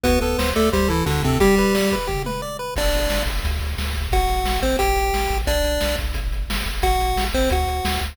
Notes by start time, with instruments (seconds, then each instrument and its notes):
0.03 synth bass 1 D2, lead 1 (square) B3 F#4 B4, kick, closed hi-hat
0.21 synth bass 1 D2, lead 1 (square) B3 A4 B4, closed hi-hat
0.38 synth bass 1 D2, lead 1 (square) C5, snare
0.56 synth bass 1 D2, lead 1 (square) A3 A4 D5, closed hi-hat
0.72 synth bass 1 D2, lead 1 (square) G3 G4 C5, kick, closed hi-hat
0.88 synth bass 1 D2, lead 1 (square) E3 E4 A4, closed hi-hat
1.06 synth bass 1 D2, lead 1 (square) D3 D4 F#4, snare
1.22 synth bass 1 D2, lead 1 (square) C3 C4 A4, kick, closed hi-hat
1.40 lead 1 (square) G3 G4, kick, closed hi-hat
1.57 lead 1 (square) B4, kick, closed hi-hat
1.75 lead 1 (square) D5, snare
1.91 lead 1 (square) B4, kick, closed hi-hat
2.07 lead 1 (square) G4, kick, floor tom
2.25 lead 1 (square) B4, mid tom
2.42 lead 1 (square) D5
2.59 lead 1 (square) B4
2.76 synth bass 1 G1, lead 1 (square) D4 D5, kick, crash
2.93 synth bass 1 G1, closed hi-hat
3.10 synth bass 1 G1, snare
3.26 synth bass 1 G1, kick, closed hi-hat
3.44 synth bass 1 D2, kick, closed hi-hat
3.61 synth bass 1 D2, closed hi-hat
3.78 synth bass 1 D2, snare
3.93 synth bass 1 D2, kick, closed hi-hat
4.11 synth bass 1 A1, lead 1 (square) F#4 F#5, kick, closed hi-hat
4.28 synth bass 1 A1, closed hi-hat
4.44 synth bass 1 A1, snare
4.61 synth bass 1 A1, lead 1 (square) C4 C5, kick, closed hi-hat
4.79 synth bass 1 A1, lead 1 (square) G4 G5, kick, closed hi-hat
4.96 synth bass 1 A1, closed hi-hat
5.13 synth bass 1 A1, snare
5.30 synth bass 1 A1, kick, closed hi-hat
5.47 synth bass 1 B1, lead 1 (square) D4 D5, kick, closed hi-hat
5.64 synth bass 1 B1, closed hi-hat
5.81 synth bass 1 B1, snare
5.98 synth bass 1 B1, kick, closed hi-hat
6.14 synth bass 1 G1, kick, closed hi-hat
6.31 synth bass 1 G1, closed hi-hat
6.48 synth bass 1 G1, snare
6.66 synth bass 1 G1, kick, closed hi-hat
6.82 synth bass 1 A1, lead 1 (square) F#4 F#5, kick, closed hi-hat
6.99 synth bass 1 A1, closed hi-hat
7.16 synth bass 1 A1, snare
7.33 synth bass 1 A1, lead 1 (square) C4 C5, kick, closed hi-hat
7.50 synth bass 1 D2, lead 1 (square) F#4 F#5, kick, closed hi-hat
7.67 synth bass 1 D2, closed hi-hat
7.85 synth bass 1 D2, snare
8.01 synth bass 1 D2, kick, closed hi-hat